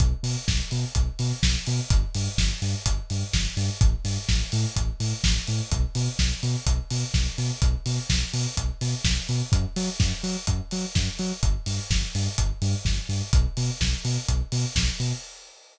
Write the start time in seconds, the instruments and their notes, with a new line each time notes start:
0.00 synth bass 2 B1, kick, closed hi-hat
0.23 synth bass 2 B2, open hi-hat
0.48 synth bass 2 B1, kick, snare
0.71 synth bass 2 B2, open hi-hat
0.95 synth bass 2 B1, kick, closed hi-hat
1.19 synth bass 2 B2, open hi-hat
1.43 synth bass 2 B1, kick, snare
1.67 synth bass 2 B2, open hi-hat
1.90 synth bass 2 G1, kick, closed hi-hat
2.14 synth bass 2 G2, open hi-hat
2.38 synth bass 2 G1, kick, snare
2.62 synth bass 2 G2, open hi-hat
2.86 synth bass 2 G1, kick, closed hi-hat
3.10 synth bass 2 G2, open hi-hat
3.33 synth bass 2 G1, kick, snare
3.57 synth bass 2 G2, open hi-hat
3.81 synth bass 2 A1, kick, closed hi-hat
4.05 synth bass 2 G2, open hi-hat
4.29 synth bass 2 A1, kick, snare
4.52 synth bass 2 A2, open hi-hat
4.76 synth bass 2 A1, kick, closed hi-hat
5.00 synth bass 2 A2, open hi-hat
5.24 synth bass 2 A1, kick, snare
5.47 synth bass 2 A2, open hi-hat
5.71 synth bass 2 B1, kick, closed hi-hat
5.95 synth bass 2 B2, open hi-hat
6.19 synth bass 2 B1, kick, snare
6.43 synth bass 2 B2, open hi-hat
6.66 synth bass 2 B1, kick, closed hi-hat
6.90 synth bass 2 B2, open hi-hat
7.14 synth bass 2 B1, kick, snare
7.38 synth bass 2 B2, open hi-hat
7.62 synth bass 2 B1, kick, closed hi-hat
7.86 synth bass 2 B2, open hi-hat
8.10 synth bass 2 B1, kick, snare
8.33 synth bass 2 B2, open hi-hat
8.57 synth bass 2 B1, kick, closed hi-hat
8.81 synth bass 2 B2, open hi-hat
9.04 synth bass 2 B1, kick, snare
9.29 synth bass 2 B2, open hi-hat
9.52 synth bass 2 F#2, kick, closed hi-hat
9.76 synth bass 2 F#3, open hi-hat
9.99 synth bass 2 F#2, kick, snare
10.23 synth bass 2 F#3, open hi-hat
10.47 synth bass 2 F#2, kick, closed hi-hat
10.71 synth bass 2 F#3, open hi-hat
10.95 synth bass 2 F#2, kick, snare
11.19 synth bass 2 F#3, open hi-hat
11.43 synth bass 2 G1, kick, closed hi-hat
11.66 synth bass 2 G2, open hi-hat
11.90 synth bass 2 G1, kick, snare
12.15 synth bass 2 G2, open hi-hat
12.38 synth bass 2 G1, kick, closed hi-hat
12.62 synth bass 2 G2, open hi-hat
12.85 synth bass 2 G1, kick, snare
13.09 synth bass 2 G2, open hi-hat
13.33 synth bass 2 B1, kick, closed hi-hat
13.57 synth bass 2 B2, open hi-hat
13.81 synth bass 2 B1, kick, snare
14.05 synth bass 2 B2, open hi-hat
14.28 synth bass 2 B1, kick, closed hi-hat
14.52 synth bass 2 B2, open hi-hat
14.75 synth bass 2 B1, kick, snare
15.00 synth bass 2 B2, open hi-hat